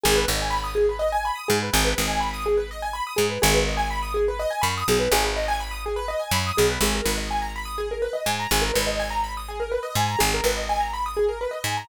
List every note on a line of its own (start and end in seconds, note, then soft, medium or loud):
0.03 0.26 G#1 medium
0.03 0.14 G#4 loud
0.16 0.27 B4 medium
0.28 1.31 G#1 medium
0.28 0.38 D#5 medium
0.42 0.53 G#5 medium
0.50 0.61 B5 medium
0.64 0.75 D#6 medium
0.75 0.86 G#4 medium
0.89 1.00 B4 medium
0.99 1.10 D#5 medium
1.12 1.23 G#5 medium
1.25 1.36 B5 medium
1.35 1.46 D#6 medium
1.48 1.70 G#2 medium
1.48 1.59 G#4 loud
1.62 1.73 B4 medium
1.73 1.94 G#1 medium
1.73 1.84 G#4 loud
1.85 1.96 B4 medium
1.98 3.01 G#1 medium
1.98 2.09 D#5 medium
2.08 2.19 G#5 medium
2.20 2.31 B5 medium
2.33 2.44 D#6 medium
2.46 2.57 G#4 medium
2.57 2.68 B4 medium
2.71 2.82 D#5 medium
2.82 2.93 G#5 medium
2.93 3.04 B5 medium
3.07 3.18 D#6 medium
3.16 3.39 G#2 medium
3.16 3.27 G#4 medium
3.30 3.40 B4 medium
3.42 4.46 G#1 loud
3.42 3.53 G#4 loud
3.54 3.65 B4 medium
3.67 3.78 D#5 medium
3.77 3.88 G#5 medium
3.91 4.01 B5 medium
4.02 4.13 D#6 medium
4.14 4.25 G#4 medium
4.28 4.39 B4 medium
4.39 4.50 D#5 loud
4.50 4.61 G#5 medium
4.61 4.84 F#2 medium
4.61 4.72 B5 medium
4.77 4.88 D#6 medium
4.88 5.08 B1 medium
4.88 5.00 G#4 medium
4.99 5.10 B4 medium
5.11 6.14 G#1 medium
5.11 5.23 G#4 loud
5.24 5.34 B4 medium
5.36 5.47 D#5 medium
5.48 5.59 G#5 loud
5.60 5.71 B5 medium
5.71 5.82 D#6 medium
5.86 5.97 G#4 medium
5.96 6.07 B4 loud
6.08 6.19 D#5 medium
6.19 6.30 G#5 medium
6.31 6.52 F#2 medium
6.31 6.44 B5 loud
6.47 6.58 D#6 medium
6.57 6.79 B1 medium
6.57 6.68 G#4 loud
6.69 6.80 B4 medium
6.81 7.01 G#1 medium
6.81 6.93 G#4 loud
6.95 7.06 A#4 medium
7.05 8.08 G#1 medium
7.05 7.16 B4 medium
7.18 7.28 D#5 medium
7.30 7.41 G#5 medium
7.42 7.53 A#5 medium
7.56 7.67 B5 medium
7.65 7.76 D#6 medium
7.78 7.89 G#4 medium
7.91 8.02 A#4 medium
8.02 8.13 B4 medium
8.13 8.24 D#5 medium
8.26 8.47 G#2 medium
8.26 8.37 G#5 medium
8.40 8.50 A#5 medium
8.51 8.71 G#1 medium
8.51 8.63 G#4 medium
8.62 8.72 A#4 medium
8.74 9.78 G#1 medium
8.74 8.85 B4 medium
8.87 8.98 D#5 medium
8.99 9.10 G#5 medium
9.10 9.21 A#5 medium
9.24 9.34 B5 medium
9.37 9.48 D#6 medium
9.48 9.59 G#4 medium
9.60 9.71 A#4 medium
9.71 9.82 B4 medium
9.83 9.94 D#5 medium
9.95 10.16 G#2 medium
9.95 10.07 G#5 medium
10.08 10.19 A#5 medium
10.19 10.41 G#1 medium
10.19 10.30 G#4 loud
10.34 10.45 A#4 medium
10.44 11.47 G#1 medium
10.44 10.55 B4 medium
10.57 10.68 D#5 medium
10.69 10.80 G#5 medium
10.80 10.91 A#5 medium
10.93 11.04 B5 medium
11.06 11.17 D#6 medium
11.17 11.27 G#4 medium
11.29 11.39 A#4 medium
11.41 11.52 B4 medium
11.51 11.62 D#5 medium
11.64 11.84 G#2 medium
11.64 11.77 G#5 medium
11.77 11.88 A#5 medium